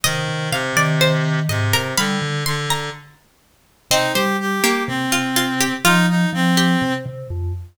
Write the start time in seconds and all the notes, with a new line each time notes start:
0.03 C3 D#3 D#5
0.28 C3
0.51 C3 F5
0.77 D#3 D5
1.01 C5
1.49 G#2 C3 D#5
1.73 C3 A#4
1.97 D3 G3 F5 B5
2.22 D3
2.46 D3 C6
2.70 A#5
3.91 C3 C4 D#4 D#5
4.13 G3 G4 C5
4.40 G4
4.64 A#3 G4
4.88 C3 C4
5.12 F4
5.36 F4
5.60 G4
5.84 F3 D#4 F4
6.09 D#4
6.33 F3 C4
6.57 G4
6.82 C3
7.06 C3
7.30 F2